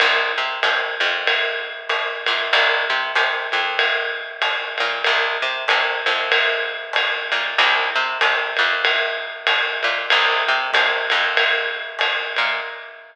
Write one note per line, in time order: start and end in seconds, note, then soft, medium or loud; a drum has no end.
0.00 0.32 C2 medium
0.00 ride medium
0.38 0.60 C3 medium
0.63 0.95 C3 medium
0.63 hi-hat pedal medium
0.63 ride medium
1.00 2.05 F2 medium
1.00 ride medium
1.27 ride medium
1.89 hi-hat pedal medium
1.89 ride medium
2.26 2.50 A#2 medium
2.26 ride medium
2.53 2.84 C2 medium
2.53 ride medium
2.90 3.12 C3 medium
3.15 3.47 C3 medium
3.15 hi-hat pedal medium
3.15 ride medium
3.52 4.57 F2 medium
3.52 ride soft
3.79 ride medium
4.42 hi-hat pedal medium
4.42 ride medium
4.78 5.03 A#2 medium
4.78 ride medium
5.04 5.38 C2 medium
5.04 ride medium
5.42 5.65 C3 medium
5.68 6.01 C3 medium
5.68 hi-hat pedal medium
5.68 ride medium
6.06 7.11 F2 medium
6.06 ride medium
6.31 kick soft
6.31 ride medium
6.93 hi-hat pedal medium
6.93 ride medium
7.32 7.54 A#2 medium
7.32 ride medium
7.58 7.90 C2 medium
7.58 ride medium
7.96 8.18 C3 medium
8.21 8.53 C3 medium
8.21 kick medium
8.21 hi-hat pedal medium
8.21 ride medium
8.57 9.63 F2 medium
8.57 ride medium
8.85 ride medium
9.47 hi-hat pedal medium
9.47 ride medium
9.83 10.06 A#2 medium
9.83 ride medium
10.10 10.43 C2 medium
10.10 ride medium
10.48 10.71 C3 medium
10.73 11.06 C3 medium
10.73 kick medium
10.73 hi-hat pedal medium
10.73 ride medium
11.10 12.16 F2 medium
11.10 ride medium
11.37 ride medium
11.99 hi-hat pedal medium
11.99 ride medium
12.36 12.60 A#2 medium
12.36 ride medium